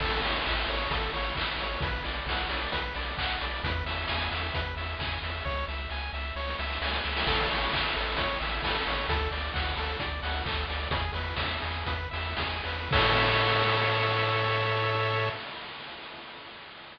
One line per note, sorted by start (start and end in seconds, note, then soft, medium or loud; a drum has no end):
0.00 0.20 A1 loud
0.00 0.21 A4 medium
0.00 kick medium
0.00 crash medium
0.23 0.42 A1 medium
0.23 0.43 C#5 medium
0.23 open hi-hat medium
0.45 0.66 A1 medium
0.45 0.65 E5 medium
0.45 kick medium
0.45 clap medium
0.68 0.87 A1 medium
0.68 0.89 C#5 medium
0.68 open hi-hat medium
0.90 1.09 A1 medium
0.90 1.12 A4 medium
0.90 kick medium
0.90 closed hi-hat medium
1.13 1.33 A1 medium
1.13 1.34 C#5 medium
1.13 open hi-hat medium
1.35 1.56 A1 medium
1.35 1.57 E5 medium
1.35 kick medium
1.35 clap medium
1.58 1.77 A1 medium
1.58 1.80 C#5 medium
1.58 open hi-hat medium
1.81 2.00 B1 medium
1.81 2.03 B4 medium
1.81 kick medium
1.81 closed hi-hat medium
2.04 2.24 B1 medium
2.04 2.25 D5 medium
2.04 open hi-hat medium
2.26 2.46 B1 medium
2.26 2.48 F#5 medium
2.26 kick medium
2.26 snare medium
2.50 2.69 B1 medium
2.50 2.71 D5 medium
2.50 open hi-hat medium
2.72 2.93 B1 medium
2.72 2.93 B4 medium
2.72 kick medium
2.72 closed hi-hat medium
2.94 3.15 B1 medium
2.94 3.16 D5 medium
2.94 open hi-hat medium
3.17 3.38 B1 medium
3.17 3.39 F#5 medium
3.17 kick medium
3.17 clap medium
3.40 3.61 B1 medium
3.40 3.62 D5 medium
3.40 open hi-hat medium
3.64 3.83 E2 loud
3.64 3.84 B4 medium
3.64 kick medium
3.64 closed hi-hat medium
3.86 4.05 E2 medium
3.86 4.07 E5 medium
3.86 open hi-hat medium
4.08 4.29 E2 medium
4.08 4.30 G#5 medium
4.08 kick medium
4.08 snare medium
4.31 4.51 E2 medium
4.31 4.53 E5 medium
4.31 open hi-hat medium
4.54 4.74 E2 medium
4.54 4.75 B4 medium
4.54 kick medium
4.54 closed hi-hat medium
4.76 4.95 E2 medium
4.76 4.97 E5 medium
4.76 open hi-hat medium
4.99 5.19 E2 medium
4.99 5.20 G#5 medium
4.99 kick medium
4.99 clap medium
5.23 5.42 E2 medium
5.23 5.44 E5 medium
5.23 open hi-hat medium
5.45 5.65 C#2 medium
5.45 5.65 C#5 medium
5.45 kick medium
5.45 snare soft
5.68 5.87 C#2 medium
5.68 5.89 E5 medium
5.68 snare medium
5.90 6.10 C#2 medium
5.90 6.12 G#5 medium
5.90 snare medium
6.13 6.32 C#2 medium
6.13 6.34 E5 medium
6.13 snare medium
6.36 6.55 C#2 medium
6.36 6.57 C#5 medium
6.36 snare medium
6.47 snare medium
6.58 6.78 C#2 medium
6.58 6.80 E5 medium
6.58 snare medium
6.70 snare medium
6.81 7.01 C#2 medium
6.81 7.03 G#5 medium
6.81 snare medium
6.93 snare medium
7.05 7.24 C#2 medium
7.05 7.25 E5 medium
7.05 snare medium
7.16 snare medium
7.27 7.46 A1 loud
7.27 7.48 A4 medium
7.27 kick medium
7.27 crash medium
7.49 7.69 A1 medium
7.49 7.71 C#5 medium
7.49 open hi-hat medium
7.73 7.93 A1 medium
7.73 7.94 E5 medium
7.73 kick medium
7.73 clap medium
7.96 8.16 A1 medium
7.96 8.16 A4 medium
7.96 open hi-hat medium
8.17 8.37 A1 medium
8.17 8.39 C#5 medium
8.17 kick medium
8.17 closed hi-hat medium
8.41 8.61 A1 medium
8.41 8.61 E5 medium
8.41 open hi-hat medium
8.62 8.82 A1 medium
8.62 8.84 A4 medium
8.62 kick medium
8.62 snare medium
8.86 9.06 A1 medium
8.86 9.07 C#5 medium
8.86 open hi-hat medium
9.09 9.28 D2 medium
9.09 9.30 A4 medium
9.09 kick medium
9.09 closed hi-hat medium
9.31 9.51 D2 medium
9.31 9.52 D5 medium
9.31 open hi-hat medium
9.54 9.74 D2 medium
9.54 9.74 F#5 medium
9.54 kick medium
9.54 snare medium
9.76 9.96 D2 medium
9.76 9.98 A4 medium
9.76 open hi-hat medium
9.99 10.20 D2 medium
9.99 10.20 D5 medium
9.99 kick medium
9.99 closed hi-hat medium
10.23 10.42 D2 medium
10.23 10.43 F#5 medium
10.23 open hi-hat medium
10.45 10.65 D2 medium
10.45 10.66 A4 medium
10.45 kick medium
10.45 clap medium
10.68 10.88 D2 medium
10.68 10.89 D5 medium
10.68 open hi-hat medium
10.90 11.10 E2 medium
10.90 11.12 G#4 medium
10.90 kick medium
10.90 closed hi-hat medium
11.13 11.34 E2 medium
11.13 11.35 B4 medium
11.13 open hi-hat medium
11.36 11.58 E2 medium
11.36 11.59 E5 medium
11.36 kick medium
11.36 snare medium
11.61 11.84 E2 medium
11.61 11.84 G#4 medium
11.61 open hi-hat medium
11.86 12.08 E2 medium
11.86 12.09 B4 medium
11.86 kick medium
11.86 closed hi-hat medium
12.11 12.35 E2 medium
12.11 12.35 E5 medium
12.11 open hi-hat medium
12.37 12.61 E2 medium
12.37 12.62 G#4 medium
12.37 kick medium
12.37 snare medium
12.64 12.88 E2 medium
12.64 12.90 B4 medium
12.64 open hi-hat medium
12.91 15.30 A2 loud
12.91 15.29 A4 loud
12.91 15.29 C#5 loud
12.91 15.29 E5 loud
12.91 kick loud
12.91 crash loud